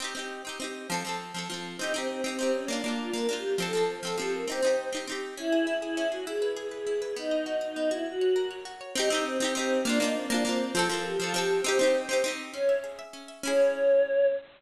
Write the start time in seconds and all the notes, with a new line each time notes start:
0.00 C4 D#4
0.04 G4
0.15 C4 D#4
0.19 G4
0.45 C4 D#4
0.49 G4
0.60 C4 D#4
0.64 G4
0.90 F3 C4
0.94 A4
1.05 F3 C4
1.09 A4
1.34 F3 C4
1.38 A4
1.50 F3 C4
1.54 A4
1.79 C4 D#4
1.83 G4
1.94 C4 D#4
1.98 G4
2.09 C4
2.24 C4 D#4
2.28 G4
2.39 C4 D#4
2.43 G4
2.54 C#4
2.68 A#3 D4
2.72 F4
2.84 A#3 D4 F4
2.88 F4
2.99 F4
3.13 A#3 D4 A#4
3.18 F4
3.28 A#3 D4 G4
3.33 F4
3.58 F3 C4 A4
3.62 A4
3.73 F3 C4
3.77 A4
3.88 C5
4.03 F3 C4 A4
4.07 A4
4.17 F3 C4 G4
4.22 A4
4.33 A#4
4.48 C4 D#4 C5
4.52 G4
4.62 C4 D#4
4.67 G4
4.93 C4 D#4
4.97 G4
5.07 C4 D#4
5.12 G4
5.37 C#4 E4
5.52 G#4
5.67 E4
5.82 E4 G#4
5.97 C#4
6.12 F#4 G#4
6.27 E4 G#4
6.42 B4
6.57 G#4
6.71 G#4 B4
6.87 E4
7.01 G#4 B4
7.16 B3 D#4
7.31 D#5
7.46 F#4
7.61 D#4 D#5
7.76 B3
7.91 E4 F#4
8.06 F#4
8.21 C#5
8.36 A#4
8.51 C#5
8.65 F#4
8.81 C#5
8.95 C4 D#4
9.00 G4
9.10 C4 D#4
9.14 G4
9.25 C4
9.40 C4 D#4
9.44 G4
9.55 C4 D#4
9.59 G4
9.85 A#3 D4
9.89 F4
10.00 A#3 D4 D#4
10.04 F4
10.15 C4
10.30 A#3 D4
10.34 F4
10.45 A#3 C4 D4
10.49 F4
10.75 F3 C4 A4
10.79 A4
10.89 F3 C4 A#4
10.94 A4
11.04 G4
11.19 F3 C4 F4
11.24 A4
11.34 F3 C4 G4
11.38 A4
11.64 C4 D#4 C5
11.68 G4
11.79 C4 D#4
11.83 G4
12.09 C4 D#4
12.13 G4
12.24 C4 D#4
12.28 G4
12.53 C#4 C#5
12.69 E5
12.84 G#4
12.99 E5
13.13 C#4
13.28 E5
13.43 C#4 E4 C#5
13.47 G#4